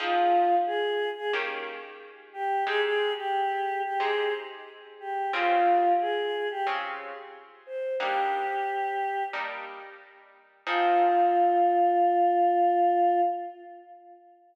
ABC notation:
X:1
M:4/4
L:1/16
Q:1/4=90
K:Fm
V:1 name="Choir Aahs"
F4 A3 A z6 G2 | A A2 G4 G A2 z4 G2 | F4 A3 G z6 c2 | G8 z8 |
F16 |]
V:2 name="Acoustic Guitar (steel)"
[F,CEA]8 [E,B,DG]8 | [A,CEG]8 [A,CEG]8 | [D,CFA]8 [D,CFA]8 | [G,B,=DE]8 [G,B,DE]8 |
[F,CEA]16 |]